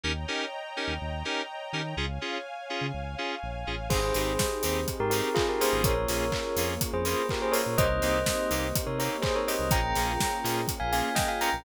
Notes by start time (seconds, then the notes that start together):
0.04 D#2 C#4 D#4 G4 A#4 C#5 D#5 G5 A#5
0.28 C#4 D#4 G4 A#4
0.77 C#4 D#4 G4 A#4
0.88 D#2
1.01 D#2
1.25 C#4 D#4 G4 A#4
1.73 D#3 C#4 D#4 G4 A#4
1.97 C#2 C#4 F4 G#4 C#5 F5 G#5
2.21 C#4 F4 G#4
2.70 C#4 F4 G#4
2.81 C#3
2.94 C#2
3.18 C#4 F4 G#4
3.43 A#1
3.67 A1 C#4 F4 G#4
3.90 G#1 C4 D#4 G4 G#4 C5, kick, crash
4.14 G#1 C4 D#4 G4 G#4, open hi-hat
4.39 kick, snare
4.63 D#2 C4 D#4 G4 G#4, open hi-hat
4.88 kick, closed hi-hat
5.00 G#2 G4 A#4
5.10 C4 D#4 G4 G#4 A#4, open hi-hat
5.34 F4 G#4, kick, clap
5.49 G4 A#4
5.60 A#3 C#4 F4 G#4 C5, open hi-hat
5.73 G#1
5.84 A#1 A#3 C#4 F4 G#4 A#4 C#5, kick, closed hi-hat
6.08 A#1 A#3 C#4 F4 G#4, open hi-hat
6.32 kick, clap
6.56 F2 A#3 C#4 F4 G#4, open hi-hat
6.81 kick, closed hi-hat
6.93 F2 G#4 C5
7.05 A#3 C#4 F4 G#4 C5, open hi-hat
7.29 G4 A#4, kick, clap
7.42 G#4 C5
7.52 A#3 C#4 F4 G#4 A#4 C#5, open hi-hat
7.66 A#2
7.78 C2 A#3 C4 D#4 G4 C5 D#5, kick, closed hi-hat
8.02 C2 A#3 C4 D#4 G4, open hi-hat
8.26 kick, snare
8.51 C2 A#3 C4 D#4 G4, open hi-hat
8.76 kick, closed hi-hat
8.87 C3 A#4 C#5
8.99 A#3 C4 D#4 G4 A#4 C#5, open hi-hat
9.22 G#4 C5, kick, clap
9.35 A#4 C#5
9.47 A#3 C4 D#4 G4 C5 D#5, open hi-hat
9.59 C2
9.71 A#1 A#3 C#4 F4 G#4 G5 A#5, kick, closed hi-hat
9.95 A#1 A#3 C#4 F4 G#4, open hi-hat
10.20 kick, snare
10.44 A#2 A#3 C#4 F4 G#4, open hi-hat
10.68 kick, closed hi-hat
10.80 A#1 F5 G#5
10.92 A#3 C#4 F4 G#4 F5 G#5, open hi-hat
11.15 D#5 G5, kick, snare
11.28 F5 G#5
11.41 A#3 C#4 F4 G#4 G5 A#5, open hi-hat
11.53 A#1